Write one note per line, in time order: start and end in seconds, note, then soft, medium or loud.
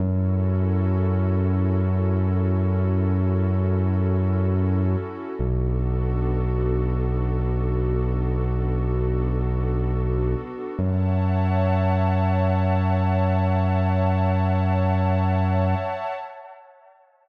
0.00 4.96 F#2 loud
0.00 5.34 C#4 loud
0.00 5.34 E4 medium
0.00 5.34 F#4 loud
0.00 5.34 A4 loud
5.39 10.35 B1 medium
5.39 10.74 B3 loud
5.39 10.74 D4 medium
5.39 10.74 F#4 loud
5.39 10.74 A4 medium
10.79 15.75 F#2 loud
10.79 16.13 C#5 loud
10.79 16.13 E5 loud
10.79 16.13 F#5 loud
10.79 16.13 A5 loud